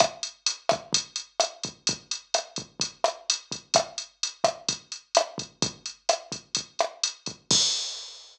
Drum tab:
CC |--------|--------|--------|--------|
HH |xxxxxxxx|xxxxxxxx|xxxxxxxx|xxxxxxxx|
SD |r--r--r-|--r--r--|r--r--r-|--r--r--|
BD |o--oo--o|o--oo--o|o--oo--o|o--oo--o|

CC |x-------|
HH |--------|
SD |--------|
BD |o-------|